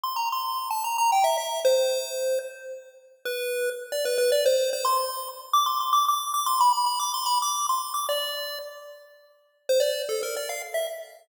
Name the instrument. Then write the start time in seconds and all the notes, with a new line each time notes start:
lead 1 (square)
0.03 C6
0.16 A#5
0.32 C6
0.71 A5
0.84 A#5
0.98 A#5
1.12 G5
1.24 E5
1.38 E5
1.65 C5
3.25 B4
3.92 D5
4.05 B4
4.18 B4
4.32 D5
4.46 C5
4.73 C5
4.85 C6
5.53 D6
5.66 C6
5.80 C6
5.93 D6
6.08 D6
6.34 D6
6.46 C6
6.60 B5
6.73 B5
6.86 B5
6.99 D6
7.14 C6
7.26 B5
7.42 D6
7.69 C6
7.94 D6
8.09 D5
9.69 C5
9.80 D5
10.09 A4
10.23 A#4
10.36 D5
10.49 F5
10.74 E5